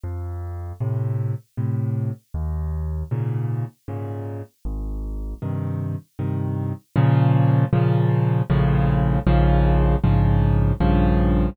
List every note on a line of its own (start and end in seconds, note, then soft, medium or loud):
0.04 0.73 F2 medium
0.80 1.34 A2 medium
0.80 1.34 C3 medium
1.57 2.11 A2 medium
1.57 2.11 C3 medium
2.34 3.04 D#2 medium
3.11 3.65 G#2 medium
3.11 3.65 A#2 medium
3.11 3.65 C#3 medium
3.88 4.42 G#2 medium
3.88 4.42 A#2 medium
3.88 4.42 C#3 medium
4.65 5.34 G#1 medium
5.42 5.96 G2 medium
5.42 5.96 C3 medium
5.42 5.96 D#3 medium
6.19 6.73 G2 medium
6.19 6.73 C3 medium
6.19 6.73 D#3 medium
6.96 7.65 A#2 loud
6.96 7.65 C#3 loud
6.96 7.65 F3 loud
7.73 8.42 A#2 loud
7.73 8.42 C#3 loud
7.73 8.42 F3 loud
8.50 9.19 A#1 loud
8.50 9.19 A2 loud
8.50 9.19 C#3 loud
8.50 9.19 F3 loud
9.27 9.96 A#1 loud
9.27 9.96 G#2 loud
9.27 9.96 C#3 loud
9.27 9.96 F3 loud
10.04 10.73 A#1 medium
10.04 10.73 G#2 loud
10.04 10.73 C#3 medium
10.04 10.73 F3 loud
10.80 11.50 A#1 loud
10.80 11.50 G2 loud
10.80 11.50 C#3 loud
10.80 11.50 F3 loud